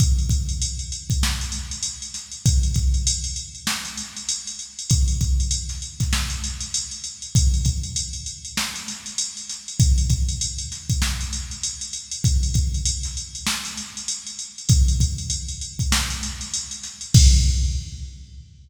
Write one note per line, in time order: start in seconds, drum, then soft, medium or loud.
0.00 kick medium
0.00 closed hi-hat medium
0.18 closed hi-hat soft
0.29 kick medium
0.29 closed hi-hat medium
0.49 closed hi-hat medium
0.62 closed hi-hat medium
0.79 closed hi-hat medium
0.92 closed hi-hat medium
1.10 kick medium
1.10 closed hi-hat medium
1.23 snare medium
1.41 closed hi-hat medium
1.52 closed hi-hat medium
1.71 closed hi-hat medium
1.83 closed hi-hat medium
2.02 closed hi-hat medium
2.14 snare soft
2.14 closed hi-hat medium
2.32 closed hi-hat medium
2.46 kick medium
2.46 closed hi-hat medium
2.63 closed hi-hat medium
2.74 kick medium
2.74 closed hi-hat medium
2.94 closed hi-hat medium
3.07 closed hi-hat loud
3.24 closed hi-hat medium
3.36 closed hi-hat medium
3.55 closed hi-hat soft
3.67 snare medium
3.85 closed hi-hat medium
3.97 closed hi-hat medium
4.17 closed hi-hat medium
4.29 closed hi-hat medium
4.47 closed hi-hat medium
4.59 closed hi-hat medium
4.79 closed hi-hat medium
4.90 kick medium
4.90 closed hi-hat medium
5.08 closed hi-hat medium
5.21 kick medium
5.21 closed hi-hat medium
5.40 closed hi-hat medium
5.51 closed hi-hat medium
5.69 snare soft
5.69 closed hi-hat medium
5.82 closed hi-hat medium
6.00 kick medium
6.00 snare soft
6.00 closed hi-hat medium
6.13 snare medium
6.30 closed hi-hat medium
6.44 closed hi-hat medium
6.60 closed hi-hat medium
6.74 closed hi-hat medium
6.91 closed hi-hat medium
7.04 closed hi-hat medium
7.22 closed hi-hat medium
7.35 kick medium
7.35 closed hi-hat medium
7.54 closed hi-hat medium
7.65 kick medium
7.65 closed hi-hat medium
7.83 closed hi-hat medium
7.96 closed hi-hat medium
8.13 closed hi-hat medium
8.26 closed hi-hat medium
8.45 closed hi-hat medium
8.57 snare medium
8.76 closed hi-hat medium
8.88 snare soft
8.88 closed hi-hat medium
9.06 closed hi-hat medium
9.18 closed hi-hat medium
9.37 closed hi-hat medium
9.49 snare soft
9.49 closed hi-hat medium
9.68 closed hi-hat medium
9.80 kick medium
9.80 closed hi-hat medium
9.98 closed hi-hat medium
10.10 kick medium
10.10 closed hi-hat medium
10.29 closed hi-hat medium
10.41 closed hi-hat medium
10.58 closed hi-hat medium
10.72 snare soft
10.72 closed hi-hat medium
10.90 kick medium
10.90 closed hi-hat medium
11.02 snare medium
11.21 closed hi-hat medium
11.33 closed hi-hat medium
11.51 closed hi-hat medium
11.63 closed hi-hat medium
11.81 closed hi-hat medium
11.93 closed hi-hat medium
12.11 closed hi-hat medium
12.24 kick medium
12.24 closed hi-hat medium
12.43 closed hi-hat medium
12.54 kick medium
12.54 closed hi-hat medium
12.74 closed hi-hat medium
12.85 closed hi-hat medium
13.03 snare soft
13.03 closed hi-hat medium
13.17 closed hi-hat medium
13.35 closed hi-hat medium
13.47 snare medium
13.65 snare soft
13.65 closed hi-hat medium
13.77 closed hi-hat medium
13.97 closed hi-hat medium
14.08 closed hi-hat medium
14.27 closed hi-hat medium
14.39 closed hi-hat medium
14.58 closed hi-hat medium
14.69 kick medium
14.69 closed hi-hat medium
14.88 closed hi-hat medium
15.00 kick medium
15.00 closed hi-hat medium
15.18 closed hi-hat medium
15.30 closed hi-hat medium
15.48 closed hi-hat medium
15.61 closed hi-hat medium
15.79 kick medium
15.79 closed hi-hat medium
15.92 snare loud
16.10 closed hi-hat medium
16.23 closed hi-hat medium
16.41 closed hi-hat medium
16.54 closed hi-hat medium
16.71 closed hi-hat medium
16.83 snare soft
16.83 closed hi-hat medium
17.01 closed hi-hat medium
17.14 kick loud
17.14 crash loud